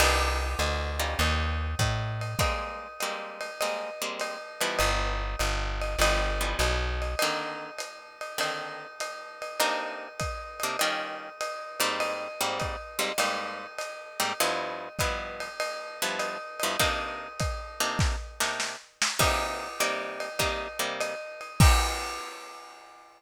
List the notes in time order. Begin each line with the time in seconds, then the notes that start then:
0.00 C2 A#3 C4 D4 D#4, crash, ride
0.59 D2, hi-hat pedal, ride
0.99 G3 C#4 D#4 F4, ride
1.19 D#2, ride
1.79 A2, kick, hi-hat pedal, ride
2.21 ride
2.39 G3 G#3 A#3 C4, kick, ride
3.00 G3 G#3 A#3 C4, hi-hat pedal, ride
3.41 ride
3.61 G3 G#3 A#3 C4, ride
4.02 G3 G#3 A#3 C4
4.20 hi-hat pedal, ride
4.61 E3 F3 G3 B3, ride
4.79 G1, ride
5.39 G1, hi-hat pedal, ride
5.82 ride
5.99 G1 E3 F3 G3 B3, ride
6.41 E3 F3 G3 B3
6.59 B1, hi-hat pedal, ride
7.02 ride
7.19 D3 D#3 A#3 C4, ride
7.79 hi-hat pedal, ride
8.21 ride
8.38 D3 D#3 A#3 C4, ride
9.00 hi-hat pedal, ride
9.42 ride
9.60 C3 A#3 D4 D#4, ride
10.20 kick, hi-hat pedal, ride
10.60 C3 A#3 D4 D#4, ride
10.79 D#3 G3 C#4 F4, ride
11.41 hi-hat pedal, ride
11.80 G#2 G3 A#3 C4, ride
12.00 ride
12.41 G#2 G3 A#3 C4
12.60 kick, hi-hat pedal, ride
12.99 G#2 G3 A#3 C4, ride
13.18 G#2 G3 A#3 C4, ride
13.79 hi-hat pedal, ride
14.20 G#2 G3 A#3 C4, ride
14.40 G2 F3 B3 E4, ride
14.99 G2 F3 B3 E4, kick, hi-hat pedal, ride
15.40 ride
15.60 ride
16.02 G2 F3 B3 E4
16.19 hi-hat pedal, ride
16.60 G2 F3 B3 E4, ride
16.80 C3 A#3 D4 D#4, kick, ride
17.39 kick, hi-hat pedal, ride
17.80 C3 A#3 D4 D#4, ride
17.99 kick, snare
18.40 C3 A#3 D4 D#4, snare
18.60 snare
19.02 snare
19.19 C3 G3 A#3 D#4, kick, crash, ride
19.80 C3 G3 A#3 D#4, hi-hat pedal, ride
20.20 ride
20.39 C3 G3 A#3 D#4, kick, ride
20.79 C3 G3 A#3 D#4
21.00 hi-hat pedal, ride
21.41 ride
21.60 A#3 C4 D#4 G4, kick, crash